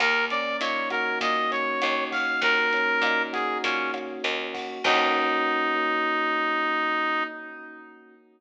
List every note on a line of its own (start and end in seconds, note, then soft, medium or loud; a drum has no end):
0.00 0.55 D#2 loud
0.00 1.21 A#3 medium
0.00 0.25 A#4 medium
0.00 kick medium
0.00 cross-stick medium
0.00 closed hi-hat medium
0.30 1.51 C#4 medium
0.30 0.57 D5 medium
0.30 closed hi-hat medium
0.61 1.16 A#2 medium
0.61 1.82 D#4 medium
0.61 0.89 C#5 medium
0.61 closed hi-hat loud
0.90 2.10 F#4 medium
0.90 1.19 A#4 medium
0.90 kick medium
0.90 cross-stick medium
0.90 closed hi-hat medium
1.21 1.75 A#2 medium
1.21 2.42 A#3 medium
1.21 1.51 D#5 medium
1.21 kick medium
1.21 closed hi-hat medium
1.51 2.73 C#4 medium
1.51 2.04 C#5 medium
1.51 closed hi-hat medium
1.82 2.38 D#2 medium
1.82 3.03 D#4 medium
1.82 cross-stick medium
1.82 closed hi-hat loud
2.11 3.33 F#4 medium
2.11 2.40 F5 medium
2.11 kick medium
2.11 open hi-hat medium
2.41 2.96 D#2 medium
2.41 3.63 A#3 medium
2.41 3.22 A#4 loud
2.41 kick medium
2.41 closed hi-hat medium
2.73 3.93 C#4 medium
2.73 closed hi-hat medium
3.02 3.56 A#2 medium
3.02 4.23 D#4 medium
3.02 cross-stick medium
3.02 closed hi-hat medium
3.33 4.54 F#4 medium
3.33 3.58 G#4 medium
3.33 kick medium
3.33 closed hi-hat medium
3.64 4.18 A#2 medium
3.64 4.79 A#3 medium
3.64 3.91 C#4 medium
3.64 kick medium
3.64 closed hi-hat loud
3.94 4.80 C#4 medium
3.94 cross-stick medium
3.94 closed hi-hat medium
4.24 4.79 D#2 loud
4.24 4.81 D#4 medium
4.24 closed hi-hat loud
4.54 4.83 F#4 medium
4.54 kick medium
4.54 open hi-hat medium
4.84 7.23 D#2 loud
4.84 7.24 A#3 loud
4.84 7.24 C#4 loud
4.84 7.23 D#4 loud
4.84 7.24 D#4 loud
4.84 7.24 F#4 loud
4.84 kick loud
4.84 crash loud